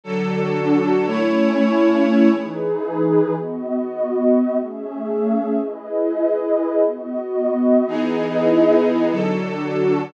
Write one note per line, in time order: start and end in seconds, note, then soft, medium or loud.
0.04 1.06 D3 medium
0.04 1.06 F#3 medium
0.04 1.06 D4 loud
0.04 1.06 F#4 medium
0.04 1.06 A4 medium
0.04 1.06 A4 loud
1.06 2.29 A3 medium
1.06 2.29 C#4 medium
1.06 2.29 E4 loud
1.06 2.29 E4 medium
1.06 2.29 C#5 medium
2.30 3.33 E3 medium
2.30 3.33 D#4 medium
2.30 3.33 G#4 medium
2.30 3.33 B4 medium
3.33 4.56 B3 medium
3.33 4.56 F#4 medium
3.33 4.56 D#5 medium
4.57 5.59 A3 medium
4.57 5.59 C#4 medium
4.57 5.59 G#4 medium
4.57 5.59 E5 medium
5.60 6.83 E4 medium
5.60 6.83 G#4 medium
5.60 6.83 B4 medium
5.60 6.83 D#5 medium
6.84 7.86 B3 medium
6.84 7.86 F#4 medium
6.84 7.86 D#5 medium
7.87 9.10 E3 loud
7.87 9.10 B3 medium
7.87 9.10 D#4 medium
7.87 9.09 E4 medium
7.87 9.09 G#4 medium
7.87 9.10 G#4 medium
7.87 9.09 B4 medium
7.87 9.09 D#5 medium
9.10 10.12 D3 medium
9.10 10.12 F#3 medium
9.10 10.13 D4 medium
9.10 10.13 F#4 medium
9.10 10.12 A4 medium
9.10 10.13 A4 medium